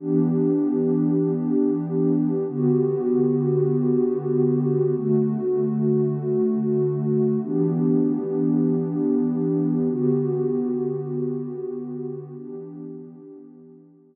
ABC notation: X:1
M:4/4
L:1/8
Q:1/4=97
K:Em
V:1 name="Pad 2 (warm)"
[E,B,DG]8 | [D,B,FG]8 | [D,A,F]8 | [E,B,DG]8 |
[D,B,FG]8 | [E,B,DG]8 |]